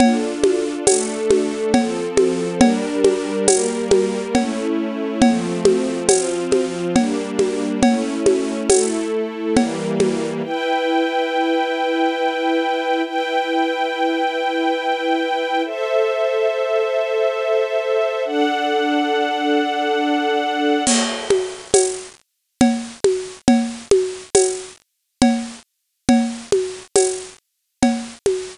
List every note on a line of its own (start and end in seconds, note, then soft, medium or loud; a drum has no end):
0.00 0.85 D4 medium
0.00 0.85 F4 medium
0.00 0.85 A4 medium
0.00 cowbell loud
0.00 low conga loud
0.43 high conga medium
0.87 1.73 A3 medium
0.87 1.73 D4 medium
0.87 1.73 A4 medium
0.87 tambourine medium
0.87 cowbell medium
0.87 high conga medium
1.30 high conga medium
1.74 2.61 F3 medium
1.74 2.61 C4 medium
1.74 2.61 A4 medium
1.74 cowbell medium
1.74 low conga medium
2.17 high conga medium
2.60 3.47 G3 medium
2.60 3.47 D4 medium
2.60 3.47 A#4 medium
2.60 cowbell medium
2.60 low conga medium
3.04 high conga medium
3.48 4.34 G3 medium
3.48 4.34 A#3 medium
3.48 4.34 A#4 medium
3.48 tambourine medium
3.48 cowbell medium
3.48 high conga medium
3.91 high conga medium
4.35 5.21 A3 medium
4.35 5.21 C#4 medium
4.35 5.21 E4 medium
4.35 cowbell medium
4.35 low conga medium
5.22 6.08 F3 medium
5.22 6.08 A3 medium
5.22 6.08 C4 medium
5.22 cowbell medium
5.22 low conga medium
5.65 high conga medium
6.08 6.94 F3 medium
6.08 6.94 C4 medium
6.08 6.94 F4 medium
6.08 tambourine medium
6.08 cowbell medium
6.08 high conga medium
6.52 high conga medium
6.95 7.82 G3 medium
6.95 7.82 A#3 medium
6.95 7.82 D4 medium
6.95 cowbell medium
6.95 low conga medium
7.39 high conga medium
7.83 8.68 A3 medium
7.83 8.70 C#4 medium
7.83 8.68 E4 medium
7.83 cowbell medium
7.83 low conga medium
8.26 high conga medium
8.69 9.55 A3 medium
8.69 9.55 E4 medium
8.69 9.55 A4 medium
8.69 tambourine medium
8.69 cowbell medium
8.69 high conga medium
9.56 10.42 E3 medium
9.56 10.42 G3 medium
9.56 10.42 A#3 medium
9.56 cowbell medium
9.56 low conga medium
10.00 high conga medium
10.44 13.02 E4 medium
10.44 13.02 B4 medium
10.44 13.02 G5 medium
13.04 15.62 E4 medium
13.04 15.62 B4 medium
13.04 15.62 G5 medium
15.65 18.23 A4 medium
15.65 18.23 C5 medium
15.65 18.23 E5 medium
18.25 20.83 D4 medium
18.25 20.83 A4 medium
18.25 20.83 F#5 medium
20.87 crash loud
20.87 cowbell medium
20.87 low conga medium
21.30 high conga medium
21.74 tambourine medium
21.74 cowbell medium
21.74 high conga medium
22.61 cowbell medium
22.61 low conga medium
23.04 high conga medium
23.48 cowbell medium
23.48 low conga medium
23.91 high conga medium
24.35 tambourine medium
24.35 cowbell medium
24.35 high conga medium
25.22 cowbell medium
25.22 low conga medium
26.09 cowbell medium
26.09 low conga medium
26.52 high conga medium
26.96 tambourine medium
26.96 cowbell medium
26.96 high conga medium
27.82 cowbell medium
27.82 low conga medium
28.26 high conga medium